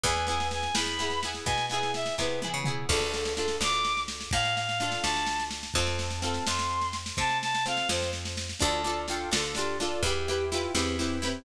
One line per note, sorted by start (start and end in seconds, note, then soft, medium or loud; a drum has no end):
0.04 0.68 E2 loud
0.04 0.26 B3 medium
0.04 0.26 E4 medium
0.04 0.26 G#4 medium
0.04 0.26 G#5 medium
0.04 kick loud
0.04 snare medium
0.16 snare medium
0.27 0.72 B3 medium
0.27 0.72 E4 medium
0.27 0.72 G#4 medium
0.27 0.47 G#5 medium
0.27 snare medium
0.40 snare medium
0.51 0.75 G#5 medium
0.51 snare medium
0.63 snare medium
0.75 1.39 E2 medium
0.75 0.97 B3 medium
0.75 0.97 E4 medium
0.75 0.97 G#4 medium
0.75 1.20 B5 medium
0.75 snare loud
0.86 snare medium
0.99 1.21 B3 medium
0.99 1.21 E4 medium
0.99 1.21 G#4 medium
0.99 snare medium
1.10 snare medium
1.23 1.67 B3 medium
1.23 1.67 E4 medium
1.23 1.67 G#4 medium
1.23 snare medium
1.34 snare medium
1.46 2.10 B2 medium
1.46 1.65 G#5 medium
1.46 kick loud
1.46 snare medium
1.58 snare medium
1.69 2.15 B3 medium
1.69 2.15 E4 medium
1.69 1.92 G#5 medium
1.69 snare medium
1.74 2.15 G#4 medium
1.83 snare medium
1.94 2.15 E5 medium
1.94 snare medium
2.06 snare medium
2.18 2.51 C3 medium
2.18 2.40 B3 medium
2.18 2.40 E4 medium
2.18 2.40 G#4 medium
2.18 2.40 B4 medium
2.18 kick medium
2.18 snare medium
2.42 2.64 B3 medium
2.42 2.64 E4 medium
2.42 2.64 G#4 medium
2.42 high tom medium
2.54 2.86 C#3 medium
2.64 2.87 B3 medium
2.64 2.87 E4 medium
2.64 2.87 G#4 medium
2.64 mid tom loud
2.89 3.53 D2 loud
2.89 3.33 D4 medium
2.89 3.33 F4 medium
2.89 3.11 A4 loud
2.89 3.33 A4 medium
2.89 kick loud
2.89 snare medium
2.89 crash loud
3.00 snare medium
3.12 3.33 A4 medium
3.12 snare medium
3.25 snare medium
3.36 4.68 D4 medium
3.36 4.68 F4 medium
3.36 3.56 A4 loud
3.36 4.68 A4 medium
3.36 snare medium
3.48 snare medium
3.61 4.25 D2 medium
3.61 4.01 D6 loud
3.61 snare loud
3.73 snare medium
3.85 snare medium
3.97 snare medium
4.08 snare loud
4.21 snare medium
4.31 4.97 A2 medium
4.31 4.55 F5 loud
4.31 kick loud
4.31 snare loud
4.45 snare medium
4.56 4.79 F5 loud
4.56 snare medium
4.69 snare medium
4.79 5.68 D4 medium
4.79 5.68 F4 medium
4.79 5.00 F5 loud
4.79 snare medium
4.83 5.68 A4 medium
4.92 snare medium
5.03 5.68 D2 medium
5.03 5.45 A5 medium
5.03 snare loud
5.16 snare medium
5.26 snare loud
5.39 snare medium
5.51 snare medium
5.63 snare medium
5.74 6.39 F2 loud
5.74 6.19 C4 medium
5.74 6.19 F4 medium
5.74 6.19 A4 medium
5.74 5.97 A5 loud
5.74 kick loud
5.74 snare medium
5.87 snare medium
5.99 6.20 A5 loud
5.99 snare medium
6.11 snare medium
6.22 7.54 C4 medium
6.22 7.54 F4 medium
6.22 7.54 A4 medium
6.22 6.46 A5 loud
6.22 snare medium
6.34 snare medium
6.47 7.12 F2 medium
6.47 6.93 C6 loud
6.47 snare loud
6.59 snare medium
6.70 snare medium
6.81 snare medium
6.93 snare medium
7.06 snare medium
7.17 7.82 C3 medium
7.17 7.38 A5 loud
7.17 kick loud
7.17 snare medium
7.29 snare medium
7.42 7.64 A5 loud
7.42 snare medium
7.54 snare medium
7.66 8.53 C4 medium
7.66 8.53 F4 medium
7.66 8.53 A4 medium
7.66 7.88 F5 loud
7.66 snare medium
7.77 snare medium
7.89 8.54 F2 medium
7.89 8.11 C5 medium
7.89 snare loud
8.02 snare medium
8.13 snare medium
8.25 snare medium
8.37 snare medium
8.49 snare medium
8.59 9.26 D2 loud
8.59 8.82 D4 medium
8.59 8.82 F4 medium
8.59 8.82 A4 medium
8.59 9.01 A5 loud
8.59 kick loud
8.59 snare medium
8.84 9.06 D4 medium
8.84 9.06 F4 medium
8.84 9.06 A4 medium
8.84 snare medium
9.08 9.30 D4 medium
9.08 9.30 F4 medium
9.08 9.30 A4 medium
9.08 9.30 G5 medium
9.08 snare medium
9.32 9.97 D2 medium
9.32 9.53 D4 medium
9.32 9.53 F4 medium
9.32 9.53 A4 medium
9.32 snare loud
9.55 9.78 D4 medium
9.55 9.78 F4 medium
9.55 9.77 G4 medium
9.55 snare medium
9.59 9.78 A4 medium
9.80 10.02 D4 medium
9.80 10.02 F4 medium
9.80 10.02 A4 medium
9.80 snare medium
10.03 10.67 E2 medium
10.03 10.26 E4 medium
10.03 10.45 G4 loud
10.03 10.26 G4 medium
10.03 kick loud
10.03 snare medium
10.07 10.26 B4 medium
10.28 10.50 E4 medium
10.28 10.50 G4 medium
10.28 10.50 B4 medium
10.28 snare medium
10.52 10.74 E4 medium
10.52 10.72 F4 loud
10.52 10.74 G4 medium
10.52 10.74 B4 medium
10.52 snare medium
10.74 11.39 E2 medium
10.74 10.96 C4 medium
10.74 10.97 E4 medium
10.74 10.97 G4 medium
10.74 10.97 B4 medium
10.74 snare loud
10.98 11.18 C4 medium
10.98 11.21 E4 medium
10.98 11.21 G4 medium
10.98 11.21 B4 medium
10.98 snare medium
11.22 11.44 C4 medium
11.22 11.44 E4 medium
11.22 11.44 G4 medium
11.22 11.44 B4 medium
11.22 snare medium